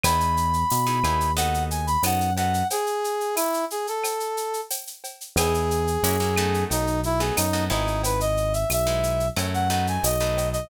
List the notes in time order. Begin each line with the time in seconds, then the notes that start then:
0.03 E2 B3 D#4 E4 G#4 B5, cowbell, claves, shaker
0.20 shaker
0.37 shaker
0.53 shaker
0.70 B2, tambourine, shaker
0.87 B3 D#4 E4 G#4, shaker
1.04 D#2 B3 D#4 E4 G#4, claves, shaker
1.20 shaker
1.37 B3 D#4 F#4 A4 F#5, cowbell, shaker
1.54 shaker
1.71 G#5, shaker
1.87 B5, shaker
2.03 F#2 B3 D#4 F#4 A4 F#5, tambourine, cowbell, claves, shaker
2.20 shaker
2.37 B3 D#4 F#4 A4 F#5, cowbell, shaker
2.54 shaker
2.70 G#4, cowbell, shaker
2.87 shaker
3.04 shaker
3.21 shaker
3.36 E4, tambourine, claves, shaker
3.54 shaker
3.70 G#4, shaker
3.87 A4, shaker
4.04 cowbell, claves, shaker
4.20 shaker
4.37 shaker
4.53 shaker
4.70 tambourine, cowbell, shaker
4.87 shaker
5.04 cowbell, shaker
5.21 shaker
5.36 E2 B3 D#4 E4 G#4, cowbell, claves, shaker
5.54 shaker
5.71 shaker
5.87 shaker
6.03 F#2 A#3 C#4 E4 F#4, tambourine, shaker
6.20 A#3 C#4 E4 F#4, shaker
6.37 A3 B3 D#4 F#4, claves, shaker
6.54 shaker
6.70 B1 D#4, cowbell, shaker
6.87 shaker
7.03 E4, shaker
7.20 A3 B3 D#4 F#4 G#4, shaker
7.36 F#2 D#4, tambourine, cowbell, claves, shaker
7.53 A3 B3 D#4 F#4, shaker
7.70 G#1 G#3 B3 D#4 E4, cowbell, shaker
7.87 shaker
8.03 B4, cowbell, shaker
8.20 D#5, shaker
8.37 shaker
8.53 E5, shaker
8.70 B1 E5, tambourine, claves, shaker
8.87 G#3 B3 D#4 E4, shaker
9.03 shaker
9.20 shaker
9.36 F#2 F#3 A3 C#4 E4, cowbell, claves, shaker
9.54 F#5, shaker
9.70 F#3 A3 B3 D#4 F#5, shaker
9.87 G#5, shaker
10.03 B1 D#5, tambourine, cowbell, shaker
10.21 F#3 A3 B3 D#4, shaker
10.37 cowbell, shaker
10.52 D#5, shaker